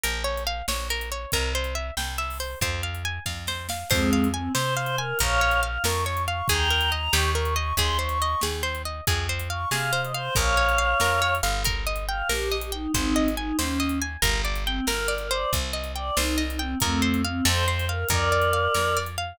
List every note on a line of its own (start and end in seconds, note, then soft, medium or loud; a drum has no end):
0.03 0.62 A#1 medium
0.03 0.23 A#4 loud
0.03 closed hi-hat medium
0.24 0.44 C#5 medium
0.37 closed hi-hat medium
0.47 0.66 F5 medium
0.68 1.26 A#1 medium
0.68 0.88 C#5 medium
0.68 snare loud
0.90 1.10 A#4 medium
1.01 closed hi-hat medium
1.12 1.31 C#5 medium
1.32 1.91 C2 loud
1.32 1.53 A#4 loud
1.32 kick medium
1.32 closed hi-hat medium
1.55 1.74 C5 medium
1.64 closed hi-hat medium
1.75 1.94 E5 medium
1.97 2.55 C2 medium
1.97 2.17 G5 medium
1.97 snare medium
2.18 2.38 E5 medium
2.30 open hi-hat medium
2.40 2.59 C5 medium
2.61 3.19 F2 medium
2.61 2.82 C5 medium
2.61 kick loud
2.61 closed hi-hat medium
2.83 3.03 F5 medium
2.95 closed hi-hat medium
3.05 3.24 G#5 medium
3.26 3.84 F2 medium
3.26 3.45 F5 medium
3.26 kick medium
3.26 snare medium
3.47 3.67 C5 medium
3.47 snare medium
3.69 3.89 F5 medium
3.69 snare loud
3.90 4.49 F2 medium
3.90 4.28 G#3 medium
3.90 4.28 C4 loud
3.90 4.10 C5 loud
3.90 kick loud
3.90 crash loud
4.13 4.32 F5 medium
4.24 closed hi-hat medium
4.34 4.52 C4 medium
4.34 4.53 G#5 medium
4.55 5.13 C3 medium
4.55 4.74 C5 medium
4.55 snare loud
4.77 4.96 C5 medium
4.77 4.96 F5 medium
4.86 closed hi-hat medium
4.98 5.18 A#4 medium
4.98 5.18 G#5 medium
5.19 5.78 A#1 loud
5.19 5.40 A#4 loud
5.19 5.61 C#5 medium
5.19 5.61 F5 loud
5.19 kick medium
5.19 closed hi-hat loud
5.41 5.61 C#5 medium
5.51 closed hi-hat medium
5.63 5.82 F5 medium
5.84 6.42 F2 medium
5.84 6.05 A#4 medium
5.84 6.03 C#6 medium
5.84 snare loud
6.05 6.25 C#5 medium
6.05 6.22 C#6 medium
6.17 closed hi-hat medium
6.28 6.47 F5 medium
6.28 6.48 C#6 medium
6.48 7.09 D#2 loud
6.48 6.69 G#4 loud
6.48 6.91 G5 medium
6.48 6.91 A#5 medium
6.48 kick loud
6.48 closed hi-hat loud
6.70 6.90 A#4 medium
6.81 closed hi-hat medium
6.92 7.11 D#5 medium
6.92 7.12 A#5 medium
7.13 7.73 D#2 loud
7.13 7.33 G4 loud
7.13 7.30 C#6 medium
7.13 snare loud
7.35 7.54 A#4 medium
7.35 7.55 C#6 medium
7.45 closed hi-hat medium
7.56 7.75 D#5 medium
7.56 7.74 C#6 medium
7.77 8.35 D#2 loud
7.77 7.98 G#4 loud
7.77 7.97 C6 medium
7.77 kick medium
7.77 closed hi-hat medium
7.99 8.18 C5 medium
7.99 8.41 C#6 medium
8.09 closed hi-hat medium
8.22 8.41 D#5 medium
8.41 9.01 D#2 medium
8.41 8.62 G#4 medium
8.41 snare loud
8.63 8.82 C5 medium
8.75 closed hi-hat medium
8.85 9.05 D#5 medium
9.07 9.65 F2 loud
9.07 9.27 G#4 medium
9.07 kick loud
9.07 closed hi-hat loud
9.29 9.49 C5 medium
9.40 closed hi-hat medium
9.50 9.69 F5 medium
9.50 9.69 C#6 medium
9.71 10.29 C3 medium
9.71 9.91 G#4 medium
9.71 10.01 F5 medium
9.71 snare loud
9.93 10.12 C5 medium
10.03 10.13 D#5 medium
10.03 closed hi-hat medium
10.14 10.34 C5 medium
10.14 10.34 F5 medium
10.35 10.94 A#1 loud
10.35 10.55 A#4 medium
10.35 11.34 C#5 medium
10.35 11.34 F5 medium
10.35 kick loud
10.35 closed hi-hat medium
10.57 10.77 C#5 medium
10.69 closed hi-hat medium
10.78 10.98 F5 medium
11.00 11.41 F2 medium
11.00 11.20 A#4 medium
11.00 snare loud
11.22 11.41 C#5 medium
11.35 closed hi-hat medium
11.43 12.23 G1 loud
11.43 11.62 F5 medium
11.65 11.85 A#4 loud
11.65 kick loud
11.65 closed hi-hat loud
11.87 12.06 D#5 medium
11.96 closed hi-hat medium
12.08 12.29 F5 medium
12.08 12.28 G5 medium
12.29 12.87 A#1 medium
12.29 12.56 G4 medium
12.29 12.49 A#4 medium
12.29 snare loud
12.52 12.71 D#5 medium
12.61 12.72 G4 medium
12.61 closed hi-hat medium
12.72 12.92 D#4 medium
12.72 12.91 G5 medium
12.94 13.52 G#1 medium
12.94 13.29 C4 medium
12.94 13.29 D#4 medium
12.94 13.14 C5 medium
12.94 kick loud
12.94 closed hi-hat medium
13.16 13.35 D#5 medium
13.28 closed hi-hat medium
13.37 13.57 D#4 medium
13.37 13.57 G#5 medium
13.58 14.17 D#2 medium
13.58 13.99 C#4 medium
13.58 13.78 C5 medium
13.58 snare loud
13.80 13.99 D#5 medium
13.89 closed hi-hat medium
14.02 14.21 G#5 medium
14.22 14.80 G1 loud
14.22 14.41 A#4 loud
14.22 kick loud
14.22 closed hi-hat loud
14.45 14.64 D5 medium
14.55 closed hi-hat medium
14.66 14.85 C4 medium
14.66 14.86 G5 medium
14.87 15.45 G1 medium
14.87 15.07 A#4 medium
14.87 15.14 A#4 medium
14.87 snare loud
15.08 15.28 D5 medium
15.18 15.30 A#4 medium
15.18 closed hi-hat medium
15.30 15.72 C5 loud
15.30 15.50 D5 medium
15.53 16.11 C2 medium
15.53 kick loud
15.53 closed hi-hat loud
15.73 15.93 D#5 medium
15.84 closed hi-hat medium
15.95 16.16 D5 medium
15.95 16.15 G5 medium
16.16 16.75 C2 loud
16.16 16.43 D#4 medium
16.16 16.37 C5 medium
16.16 snare loud
16.38 16.57 D#5 medium
16.49 16.60 D#4 medium
16.49 closed hi-hat medium
16.59 16.78 C4 medium
16.59 16.79 G5 medium
16.80 17.41 F2 loud
16.80 17.22 A3 medium
16.80 17.22 C4 medium
16.80 17.01 A#4 loud
16.80 kick loud
16.80 closed hi-hat loud
17.02 17.21 C5 medium
17.14 closed hi-hat medium
17.24 17.45 C4 medium
17.24 17.44 F5 medium
17.45 18.04 F2 loud
17.45 17.65 A4 loud
17.45 17.65 C5 medium
17.45 snare loud
17.67 17.85 C5 medium
17.67 17.87 C5 medium
17.79 closed hi-hat medium
17.89 18.07 A#4 medium
17.89 18.08 F5 medium
18.09 18.68 F2 loud
18.09 18.98 A#4 medium
18.09 18.29 A#4 loud
18.09 18.98 D5 medium
18.09 kick loud
18.09 closed hi-hat loud
18.32 18.51 D5 medium
18.42 closed hi-hat medium
18.53 18.72 F5 medium
18.74 19.33 F2 medium
18.74 18.94 A#4 medium
18.74 snare loud
18.97 19.16 D5 medium
19.06 closed hi-hat medium
19.18 19.37 F5 medium